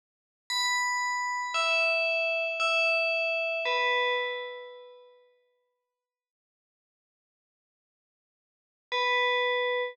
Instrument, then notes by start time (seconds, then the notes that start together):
tubular bells
0.50 B5
1.54 E5
2.60 E5
3.66 B4
8.92 B4